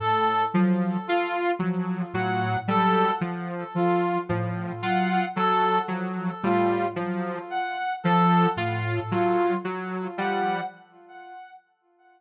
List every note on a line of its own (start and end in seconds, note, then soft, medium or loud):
0.00 0.43 A2 medium
0.00 0.43 A4 medium
0.54 0.97 F3 medium
0.54 0.96 F#3 medium
1.07 1.50 F4 medium
1.07 1.52 F4 medium
1.59 2.04 F3 medium
1.59 2.02 F#3 medium
2.14 2.56 A2 medium
2.14 2.57 F#3 medium
2.14 2.57 F#5 medium
2.67 3.10 F#3 medium
2.67 3.11 G3 medium
2.67 3.11 A4 medium
3.21 3.64 F3 medium
3.75 4.17 F3 medium
3.75 4.18 F4 medium
4.29 4.72 A2 medium
4.29 4.72 F3 medium
4.82 5.25 F#3 medium
4.82 5.25 F4 medium
4.82 5.25 F#5 medium
5.36 5.79 F#3 medium
5.36 5.79 A4 medium
5.88 6.32 F3 medium
5.88 6.31 F#3 medium
6.43 6.86 A2 medium
6.43 6.86 G3 medium
6.43 6.86 F4 medium
6.96 7.39 F3 medium
6.96 7.40 F#3 medium
7.50 7.93 F#5 medium
8.04 8.47 F3 medium
8.04 8.46 A4 medium
8.56 8.99 A2 medium
8.56 9.00 F4 medium
9.11 9.54 F#3 medium
9.11 9.54 F4 medium
9.65 10.07 F#3 medium
10.18 10.61 F3 medium
10.18 10.61 G3 medium
10.18 10.61 F#5 medium